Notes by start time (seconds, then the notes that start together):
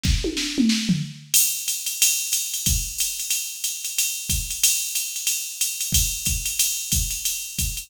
0.03 kick, snare
0.24 high tom
0.37 snare
0.58 mid tom
0.69 snare
0.89 floor tom
1.34 crash, ride
1.68 hi-hat pedal, ride
1.86 ride
2.02 ride
2.32 hi-hat pedal, ride
2.54 ride
2.66 kick, ride
2.98 hi-hat pedal, ride
3.20 ride
3.30 ride
3.64 hi-hat pedal, ride
3.84 ride
3.98 ride
4.29 kick, hi-hat pedal, ride
4.50 ride
4.64 ride
4.95 hi-hat pedal, ride
5.16 ride
5.27 ride
5.61 hi-hat pedal, ride
5.81 ride
5.92 kick, ride
6.25 kick, hi-hat pedal, ride
6.46 ride
6.59 ride
6.92 kick, hi-hat pedal, ride
7.11 ride
7.25 ride
7.59 kick, hi-hat pedal, ride
7.77 ride